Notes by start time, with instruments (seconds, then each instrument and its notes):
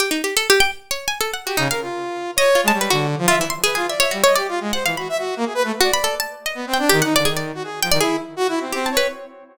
0.00 harpsichord G4
0.11 harpsichord D#4
0.24 harpsichord G4
0.37 harpsichord A4
0.50 harpsichord G4
0.60 harpsichord G5
0.91 harpsichord C#5
1.08 harpsichord G#5
1.21 harpsichord A4
1.33 harpsichord F#5
1.45 harpsichord F#4, lead 2 (sawtooth) G4
1.57 lead 2 (sawtooth) C#3, harpsichord D#4
1.70 lead 2 (sawtooth) A#4, harpsichord F5
1.82 lead 2 (sawtooth) F4
2.36 lead 2 (sawtooth) C#5, harpsichord D#5
2.55 harpsichord F4
2.64 lead 2 (sawtooth) G#3
2.68 harpsichord A5
2.73 lead 2 (sawtooth) G3
2.81 harpsichord B4
2.90 lead 2 (sawtooth) D3, harpsichord F#4
3.18 lead 2 (sawtooth) F3
3.28 harpsichord F4, lead 2 (sawtooth) E5
3.37 lead 2 (sawtooth) E3
3.41 harpsichord E4
3.50 harpsichord C6
3.64 harpsichord G#4, lead 2 (sawtooth) B4
3.75 lead 2 (sawtooth) F4, harpsichord G#4
3.88 lead 2 (sawtooth) D5, harpsichord E5
4.00 harpsichord C#5, lead 2 (sawtooth) E5
4.11 lead 2 (sawtooth) G3, harpsichord F#4
4.24 harpsichord C#5, lead 2 (sawtooth) D#5
4.36 lead 2 (sawtooth) G4, harpsichord D5
4.48 lead 2 (sawtooth) F4
4.61 lead 2 (sawtooth) G#3
4.73 lead 2 (sawtooth) C5, harpsichord F#5
4.85 lead 2 (sawtooth) E3, harpsichord F5
4.97 lead 2 (sawtooth) F#4, harpsichord B5
5.09 lead 2 (sawtooth) E5
5.18 lead 2 (sawtooth) F#4
5.37 lead 2 (sawtooth) A#3
5.45 lead 2 (sawtooth) G#4
5.54 lead 2 (sawtooth) B4
5.64 lead 2 (sawtooth) A3
5.81 harpsichord F#4, lead 2 (sawtooth) D5
5.93 harpsichord B5
6.04 harpsichord A4
6.20 harpsichord A5
6.46 harpsichord D#5
6.55 lead 2 (sawtooth) B3
6.67 lead 2 (sawtooth) C4
6.74 harpsichord G5
6.79 lead 2 (sawtooth) D4
6.89 lead 2 (sawtooth) D#3, harpsichord G4
7.02 lead 2 (sawtooth) D#4, harpsichord F#5
7.15 lead 2 (sawtooth) D3, harpsichord D5
7.25 lead 2 (sawtooth) D#3, harpsichord G#4
7.37 harpsichord D5
7.55 lead 2 (sawtooth) F#4
7.64 lead 2 (sawtooth) G#4
7.82 lead 2 (sawtooth) F3, harpsichord G5
7.91 lead 2 (sawtooth) D#3, harpsichord D5
8.00 lead 2 (sawtooth) E4, harpsichord G#4
8.36 lead 2 (sawtooth) F#4
8.48 lead 2 (sawtooth) E4
8.61 lead 2 (sawtooth) C4
8.72 lead 2 (sawtooth) C4, harpsichord G4
8.86 harpsichord A5
8.91 lead 2 (sawtooth) C#5
8.97 harpsichord B4